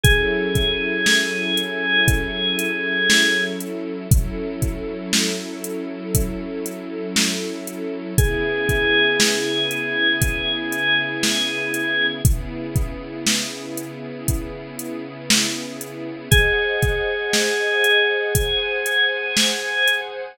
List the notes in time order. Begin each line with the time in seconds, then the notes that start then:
0.03 F#3 C#4 E4 G#4 A4, kick, closed hi-hat
0.55 kick, closed hi-hat
1.06 snare
1.57 closed hi-hat
2.08 kick, closed hi-hat
2.59 closed hi-hat
3.10 snare
3.60 closed hi-hat
4.11 F#3 C#4 E4 A4, kick, closed hi-hat
4.62 kick, closed hi-hat
5.13 snare
5.64 closed hi-hat
6.15 kick, closed hi-hat
6.66 closed hi-hat
7.16 snare
7.67 closed hi-hat
8.18 C#3 B3 E4 G#4, kick, closed hi-hat
8.69 kick, closed hi-hat
9.20 snare
9.71 closed hi-hat
10.22 kick, closed hi-hat
10.72 closed hi-hat
11.23 snare
11.74 closed hi-hat
12.25 C#3 B3 E4 G#4, kick, closed hi-hat
12.76 kick, closed hi-hat
13.26 snare
13.77 closed hi-hat
14.28 kick, closed hi-hat
14.79 closed hi-hat
15.30 snare
15.81 closed hi-hat
16.31 G#4 C5 D#5 F#5, kick, closed hi-hat
16.82 kick, closed hi-hat
17.33 snare
17.84 closed hi-hat
18.35 G#4 C5 F#5 G#5, kick, closed hi-hat
18.86 closed hi-hat
19.37 snare
19.87 closed hi-hat